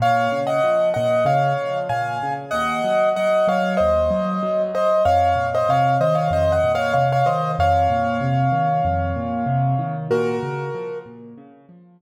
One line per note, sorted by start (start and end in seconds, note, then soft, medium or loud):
0.00 0.28 A#2 loud
0.00 0.40 C#5 medium
0.00 0.40 F5 medium
0.32 0.60 C#3 medium
0.47 0.89 D#5 medium
0.47 0.89 F#5 medium
0.64 0.92 F3 medium
0.94 1.25 A#2 medium
0.94 1.24 D#5 medium
0.94 1.24 F#5 medium
1.25 1.54 C#3 medium
1.25 1.78 C#5 medium
1.25 1.78 F5 medium
1.59 1.88 F3 medium
1.89 2.18 A#2 medium
1.89 2.33 F5 medium
1.89 2.33 G#5 medium
2.23 2.51 C#3 medium
2.51 2.81 D#2 loud
2.51 3.09 D#5 medium
2.51 3.09 F#5 medium
2.84 3.13 F#3 medium
3.16 3.46 F#3 medium
3.16 3.47 D#5 medium
3.16 3.47 F#5 medium
3.48 3.76 F#3 medium
3.48 3.75 C#5 medium
3.48 3.75 F5 medium
3.77 4.09 D#2 medium
3.77 4.62 C5 medium
3.77 4.62 D#5 medium
4.11 4.39 F#3 medium
4.43 4.71 F#3 medium
4.73 5.02 F#3 medium
4.73 5.03 C5 medium
4.73 5.03 D#5 medium
5.05 5.34 F2 medium
5.05 5.47 C#5 medium
5.05 5.47 F5 medium
5.36 5.64 A#2 medium
5.55 5.70 C5 medium
5.55 5.70 D#5 medium
5.69 5.97 C3 medium
5.69 5.97 C#5 medium
5.69 5.97 F5 medium
6.01 6.29 D#3 medium
6.01 6.16 C5 medium
6.01 6.16 D#5 medium
6.15 6.30 C#5 medium
6.15 6.30 F5 medium
6.31 6.59 F2 medium
6.31 6.53 C5 medium
6.31 6.52 D#5 medium
6.52 6.72 D#5 medium
6.52 6.72 F#5 medium
6.64 6.92 A#2 medium
6.75 6.93 C#5 medium
6.75 6.93 F5 medium
6.93 7.23 C3 medium
6.93 7.08 C#5 medium
6.93 7.08 F5 medium
7.13 7.28 C#5 medium
7.13 7.28 F5 medium
7.26 7.55 D#3 medium
7.26 7.51 C5 medium
7.26 7.51 D#5 medium
7.59 7.87 F2 loud
7.59 9.93 C#5 medium
7.59 9.93 F5 medium
7.90 8.18 A#2 medium
8.21 8.49 C3 medium
8.52 8.80 D#3 medium
8.85 9.13 F2 medium
9.16 9.44 A#2 medium
9.46 9.75 C3 medium
9.79 10.07 D#3 medium
10.11 10.39 A#2 loud
10.11 10.99 F#4 medium
10.11 10.99 A#4 medium
10.43 10.71 C#3 medium
10.75 11.03 F3 medium
11.06 11.34 A#2 medium
11.38 11.66 C#3 medium
11.69 11.97 F3 medium
12.00 12.01 A#2 medium